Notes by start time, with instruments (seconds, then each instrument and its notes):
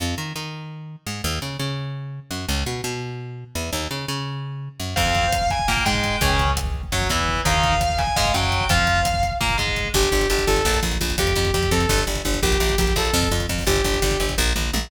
0.00 electric bass (finger) F2
0.18 electric bass (finger) D#3
0.36 electric bass (finger) D#3
1.07 electric bass (finger) G#2
1.24 electric bass (finger) D#2
1.42 electric bass (finger) C#3
1.59 electric bass (finger) C#3
2.31 electric bass (finger) F#2
2.48 electric bass (finger) C#2
2.66 electric bass (finger) B2
2.84 electric bass (finger) B2
3.55 electric bass (finger) E2
3.73 electric bass (finger) D#2
3.91 electric bass (finger) C#3
4.08 electric bass (finger) C#3
4.80 electric bass (finger) F#2
4.96 electric bass (finger) F2, overdriven guitar C4 F4, distortion guitar F5, kick, crash
5.06 kick
5.15 kick, closed hi-hat
5.24 kick
5.32 kick, closed hi-hat
5.41 kick
5.50 distortion guitar G#5, kick, closed hi-hat
5.59 kick
5.68 electric bass (finger) A#2, overdriven guitar A#3, distortion guitar G5, kick, snare
5.77 kick
5.85 electric bass (finger) G#2, overdriven guitar G#3, distortion guitar G5, kick, closed hi-hat
5.94 kick
6.04 kick, closed hi-hat
6.21 electric bass (finger) C#2, overdriven guitar C#4 G#4, kick, closed hi-hat
6.30 kick
6.39 kick, closed hi-hat
6.47 kick
6.57 kick, closed hi-hat
6.65 kick
6.74 kick
6.83 kick
6.92 electric bass (finger) F#2, overdriven guitar F#3, kick, snare, closed hi-hat
7.01 kick
7.09 electric bass (finger) E2, overdriven guitar E3, kick, closed hi-hat
7.19 kick
7.28 kick
7.36 kick
7.45 electric bass (finger) D#2, overdriven guitar D#4 A#4, distortion guitar F5, kick, closed hi-hat
7.54 kick
7.63 kick, closed hi-hat
7.72 kick
7.81 kick, closed hi-hat
7.90 kick
7.98 distortion guitar G#5, kick, closed hi-hat
8.07 kick
8.16 electric bass (finger) G#2, overdriven guitar G#3, distortion guitar F5, kick, snare
8.25 kick
8.34 electric bass (finger) F#2, overdriven guitar F#3, distortion guitar G5, kick, closed hi-hat
8.43 kick
8.52 kick, closed hi-hat
8.61 kick
8.69 electric bass (finger) F2, overdriven guitar F4 C5, distortion guitar F5, kick, closed hi-hat
8.78 kick
8.87 kick, closed hi-hat
8.96 kick
9.05 kick, closed hi-hat
9.14 kick
9.23 kick, closed hi-hat
9.31 kick
9.41 electric bass (finger) A#2, overdriven guitar A#3, kick, snare
9.50 kick
9.58 electric bass (finger) G#2, overdriven guitar G#3, kick, closed hi-hat
9.67 kick
9.76 kick, closed hi-hat
9.85 kick
9.94 electric bass (finger) G1, lead 2 (sawtooth) G4, kick, crash
10.03 kick, closed hi-hat
10.11 electric bass (finger) G1, kick, closed hi-hat
10.21 kick, closed hi-hat
10.30 electric bass (finger) G1, lead 2 (sawtooth) G4, closed hi-hat
10.38 kick, closed hi-hat
10.47 electric bass (finger) G1, lead 2 (sawtooth) A4, kick, closed hi-hat
10.56 kick, closed hi-hat
10.65 electric bass (finger) A#1, kick, snare
10.74 kick, closed hi-hat
10.83 electric bass (finger) A#1, kick, closed hi-hat
10.92 kick, closed hi-hat
11.00 electric bass (finger) A#1, kick, closed hi-hat
11.09 kick, closed hi-hat
11.18 electric bass (finger) F2, lead 2 (sawtooth) G4, kick, closed hi-hat
11.27 kick, closed hi-hat
11.36 electric bass (finger) F2, kick, closed hi-hat
11.45 kick, closed hi-hat
11.53 electric bass (finger) F2, lead 2 (sawtooth) G4, kick, closed hi-hat
11.63 kick, closed hi-hat
11.71 electric bass (finger) F2, lead 2 (sawtooth) A4, kick, closed hi-hat
11.80 kick, closed hi-hat
11.89 electric bass (finger) G1, kick, snare
11.98 kick, closed hi-hat
12.07 electric bass (finger) G1, kick, closed hi-hat
12.15 kick, closed hi-hat
12.25 electric bass (finger) G1, kick, closed hi-hat
12.34 kick, closed hi-hat
12.42 electric bass (finger) A#1, lead 2 (sawtooth) G4, kick
12.51 kick, closed hi-hat
12.60 electric bass (finger) A#1, kick, closed hi-hat
12.69 kick, closed hi-hat
12.78 electric bass (finger) A#1, lead 2 (sawtooth) G4, kick, closed hi-hat
12.87 kick, closed hi-hat
12.96 electric bass (finger) A#1, lead 2 (sawtooth) A4, kick, closed hi-hat
13.05 closed hi-hat
13.13 electric bass (finger) F2, kick, snare
13.22 kick, closed hi-hat
13.31 electric bass (finger) F2, kick, closed hi-hat
13.40 kick, closed hi-hat
13.49 electric bass (finger) F2, kick, closed hi-hat
13.58 kick, open hi-hat
13.67 electric bass (finger) G1, lead 2 (sawtooth) G4, kick, closed hi-hat
13.76 kick, closed hi-hat
13.84 electric bass (finger) G1, kick, closed hi-hat
13.94 kick, closed hi-hat
14.02 electric bass (finger) G1, kick, closed hi-hat
14.11 kick, closed hi-hat
14.20 electric bass (finger) G1, kick, closed hi-hat
14.29 kick, closed hi-hat
14.38 electric bass (finger) A#1, kick, floor tom
14.56 electric bass (finger) A#1, mid tom
14.73 electric bass (finger) A#1, high tom